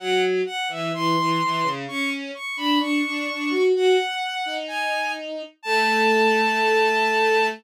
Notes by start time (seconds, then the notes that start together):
0.00 F#3 F#5
0.46 F#5
0.68 E3 E5
0.93 E3 C6
1.18 E3
1.42 E3
1.63 C#3
1.88 C#4 C#6
2.35 C#6
2.57 D4 B5
2.79 D4 C#6
3.05 D4
3.30 D4
3.50 F#4
3.74 F#4 F#5
4.46 D#4
4.68 G#5
5.62 A3 A5